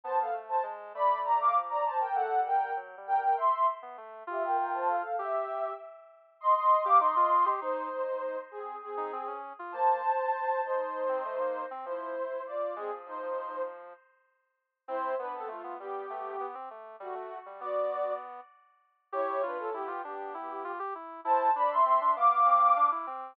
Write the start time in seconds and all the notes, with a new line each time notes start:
0.04 B3 C5 A5
0.20 A4 F5
0.33 A3
0.49 C5 A5
0.63 G#3
0.94 A3 D5 B5
1.24 D5 A#5
1.41 F5 D6
1.56 F3
1.70 D5 A#5
1.85 C5 A5
2.00 A#4 G5
2.14 A3 A4 F#5
2.31 G3
2.46 A#4 G5
2.77 F#3
2.97 G3
3.07 A#4 G5
3.16 G3
3.21 A#4 G5
3.37 E5 C6
3.82 B3
3.97 A3
4.27 F4 G4 E5
4.43 A#4 G5
4.57 A#4 G5
4.73 C5 A5
4.88 A4 F5
5.19 G4 E5
5.34 G4
6.41 D#5 C6
6.55 D#5 C6
6.84 G4 F5 D6
6.99 D#4 D#5 C6
7.16 F4
7.46 G4
7.61 D#4 C5
8.51 C4 G#4
8.82 C4 G#4
8.97 D#4
9.13 C4
9.27 C#4
9.59 F4
9.72 A#3 C5 A5
10.64 D#4 C5
11.09 C4
11.25 A3
11.40 A#3
11.71 C4
11.85 F3 E4 C5
12.47 F4 D5
12.76 G#3 C4 G#4
12.91 F3
13.06 F3 D#4 C5
13.22 F3
14.88 C4 E4 C5
15.19 B3 D4 B4
15.34 C4 A4
15.48 A3 F4
15.64 B3
15.79 G3 B3 G4
16.10 A3
16.40 B3
16.55 C4
16.71 A3
17.00 G3 A3 F#4
17.15 A3
17.46 G3
17.60 B3 F#4 D5
19.12 E4 G4 C#5
19.43 D4 F4 B4
19.59 C#4 A4
19.74 B3 E4 G4
19.88 F4
20.04 B3 D4 G4
20.34 E4
20.64 F4
20.79 G4
20.95 E4
21.25 E4 C5 A5
21.56 D4 D5 B5
21.70 E5 C6
21.85 C4 E5 C6
22.01 D4
22.16 B3 F5 D6
22.46 C4
22.76 D4
22.92 E4
23.07 C4